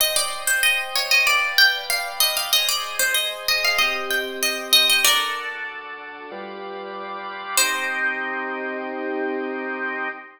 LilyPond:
<<
  \new Staff \with { instrumentName = "Harpsichord" } { \time 4/4 \key c \minor \tempo 4 = 95 ees''16 d''8 c''16 ees''8 des''16 ees''16 d''8 g''8 f''8 ees''16 f''16 | ees''16 d''8 c''16 ees''8 ees''16 f''16 ees''8 g''8 ees''8 ees''16 ees''16 | <bes' d''>2~ <bes' d''>8 r4. | c''1 | }
  \new Staff \with { instrumentName = "Drawbar Organ" } { \time 4/4 \key c \minor <c'' ees'' g''>2 <b' d'' f'' g''>2 | <aes' c'' ees''>2 <c' g' ees''>2 | <d' fis' a'>2 <g f' b' d''>2 | <c' ees' g'>1 | }
>>